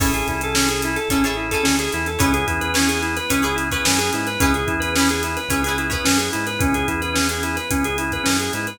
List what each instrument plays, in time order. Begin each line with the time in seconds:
0.00 synth bass 1 A1, drawbar organ C#4 E4 G#4 A4, pizzicato strings E4 G#4 A4 C#5, kick, crash
0.14 drawbar organ G#4, closed hi-hat
0.27 synth bass 1 C2, drawbar organ E4, kick, closed hi-hat
0.41 drawbar organ A4, closed hi-hat
0.55 drawbar organ C#4, pizzicato strings G#4 A4 C#5, snare
0.59 pizzicato strings E4
0.68 drawbar organ G#4, closed hi-hat
0.82 drawbar organ E4, closed hi-hat
0.96 drawbar organ A4, closed hi-hat
1.08 synth bass 1 A1, drawbar organ C#4 E4 G#4 A4, pizzicato strings E4 G#4 A4 C#5, kick, closed hi-hat
1.24 pizzicato strings E4 G#4 A4 C#5, drawbar organ G#4, snare, closed hi-hat
1.37 drawbar organ E4
1.51 pizzicato strings E4 G#4 A4 C#5, drawbar organ A4, kick, closed hi-hat
1.63 synth bass 1 D2, drawbar organ C#4, snare
1.79 drawbar organ G#4, closed hi-hat
1.92 synth bass 1 E2, drawbar organ E4, closed hi-hat
2.06 drawbar organ A4, closed hi-hat
2.19 synth bass 1 C#2, drawbar organ B3 C#4 E4 G#4, pizzicato strings E4 G#4 B4 C#5, kick, closed hi-hat
2.34 drawbar organ G#4, closed hi-hat
2.47 synth bass 1 E2, drawbar organ E4, kick, closed hi-hat
2.61 drawbar organ B4, closed hi-hat
2.74 drawbar organ C#4, pizzicato strings E4 G#4 B4 C#5, snare
2.88 drawbar organ G#4, closed hi-hat
3.03 drawbar organ E4, closed hi-hat
3.17 drawbar organ B4, closed hi-hat
3.30 synth bass 1 C#2, drawbar organ B3 C#4 E4 G#4, pizzicato strings E4 G#4 B4 C#5, kick, closed hi-hat
3.42 pizzicato strings E4 G#4 B4 C#5, drawbar organ G#4, closed hi-hat
3.56 drawbar organ E4, closed hi-hat
3.71 pizzicato strings E4 G#4 B4 C#5, drawbar organ B4, kick, closed hi-hat
3.85 synth bass 1 F#2, drawbar organ C#4, snare
3.98 drawbar organ G#4, closed hi-hat
4.13 synth bass 1 G#2, drawbar organ E4, closed hi-hat
4.27 drawbar organ B4, closed hi-hat
4.40 synth bass 1 C#2, drawbar organ B3 C#4 E4 G#4, pizzicato strings E4 G#4 B4 C#5, kick, closed hi-hat
4.54 drawbar organ G#4, closed hi-hat
4.67 synth bass 1 E2, drawbar organ E4, kick, closed hi-hat
4.80 drawbar organ B4, closed hi-hat
4.96 drawbar organ C#4, pizzicato strings G#4 B4 C#5, snare
5.00 pizzicato strings E4
5.09 drawbar organ G#4, snare, closed hi-hat
5.23 drawbar organ E4, closed hi-hat
5.37 drawbar organ B4, closed hi-hat
5.49 synth bass 1 C#2, drawbar organ B3 C#4 E4 G#4, pizzicato strings E4 G#4 B4 C#5, kick, closed hi-hat
5.64 drawbar organ G#4, pizzicato strings B4 C#5, closed hi-hat
5.68 pizzicato strings E4 G#4
5.78 drawbar organ E4, closed hi-hat
5.90 pizzicato strings E4 G#4 B4 C#5, drawbar organ B4, kick, closed hi-hat
6.05 synth bass 1 F#2, drawbar organ C#4, snare
6.18 drawbar organ G#4, closed hi-hat
6.33 synth bass 1 G#2, drawbar organ E4, closed hi-hat
6.47 drawbar organ B4, closed hi-hat
6.59 synth bass 1 C#2, drawbar organ B3 C#4 E4 G#4, kick, closed hi-hat
6.74 drawbar organ G#4, closed hi-hat
6.88 synth bass 1 E2, drawbar organ E4, kick, closed hi-hat
7.01 drawbar organ B4, closed hi-hat
7.14 drawbar organ C#4, snare
7.29 drawbar organ G#4, closed hi-hat
7.43 drawbar organ E4, closed hi-hat
7.56 drawbar organ B4, closed hi-hat
7.70 synth bass 1 C#2, drawbar organ B3 C#4 E4 G#4, kick, closed hi-hat
7.84 drawbar organ G#4, closed hi-hat
7.98 drawbar organ E4, closed hi-hat
8.12 drawbar organ B4, kick, closed hi-hat
8.24 synth bass 1 F#2, drawbar organ C#4, snare
8.40 drawbar organ G#4, closed hi-hat
8.53 synth bass 1 G#2, drawbar organ E4, closed hi-hat
8.67 drawbar organ B4, closed hi-hat